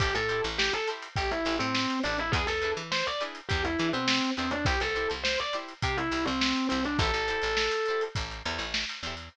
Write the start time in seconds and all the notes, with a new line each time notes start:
0.00 A1 E4 G4 A4 C5, kick, closed hi-hat
0.15 A2 A4, snare, closed hi-hat
0.29 E4 G4 A4 C5, closed hi-hat
0.44 A1, closed hi-hat
0.58 G4, snare
0.73 A4, closed hi-hat
0.87 E4 G4 A4 C5, closed hi-hat
1.02 closed hi-hat
1.16 A1 G4, kick, closed hi-hat
1.30 E4, snare, closed hi-hat
1.45 A1 E4 G4 A4 C5, closed hi-hat
1.59 A2 C4, closed hi-hat
1.75 snare
1.90 closed hi-hat
2.03 A1 D4 E4 G4 A4 C5, closed hi-hat
2.18 E4, closed hi-hat
2.32 E2 E4 G#4 B4, kick, closed hi-hat
2.36 D4
2.47 E2 A4, snare, closed hi-hat
2.62 D4 E4 G#4 B4, closed hi-hat
2.77 E3, closed hi-hat
2.92 C5, snare
3.07 D5, closed hi-hat
3.20 D4 E4 G#4 B4, closed hi-hat
3.35 closed hi-hat
3.49 E2 G4, kick, closed hi-hat
3.65 E4, closed hi-hat
3.79 E3 D4 E4 G#4 B4, closed hi-hat
3.93 B2 C4, closed hi-hat
4.08 snare
4.22 closed hi-hat
4.37 E2 C4 D4 E4 G#4 B4, closed hi-hat
4.51 D4, closed hi-hat
4.65 C2 E4 G4 C5, kick, closed hi-hat
4.80 C2 A4, snare, closed hi-hat
4.95 E4 G4 C5, closed hi-hat
5.10 C2, closed hi-hat
5.24 C5, snare
5.39 D5, closed hi-hat
5.53 E4 G4 C5, snare, closed hi-hat
5.68 closed hi-hat
5.82 C3 G4, kick, closed hi-hat
5.97 E4, closed hi-hat
6.11 C2 E4 G4 C5, closed hi-hat
6.25 C2 C4, closed hi-hat
6.41 snare
6.56 closed hi-hat
6.69 C2 C4 E4 G4 C5, closed hi-hat
6.85 D4, snare, closed hi-hat
6.99 A1 G4 A4 C5, kick, closed hi-hat
7.03 E4
7.13 A1, snare, closed hi-hat
7.28 E4 G4 A4 C5, closed hi-hat
7.42 A1, closed hi-hat
7.57 snare
7.71 closed hi-hat
7.86 A4 C5, closed hi-hat
7.90 E4 G4
8.01 closed hi-hat
8.15 A1, kick, closed hi-hat
8.31 closed hi-hat
8.45 E2 E4 G4 A4 C5, closed hi-hat
8.59 A1, closed hi-hat
8.74 snare
8.89 closed hi-hat
9.03 E2 G4 A4 C5, closed hi-hat
9.07 E4
9.17 closed hi-hat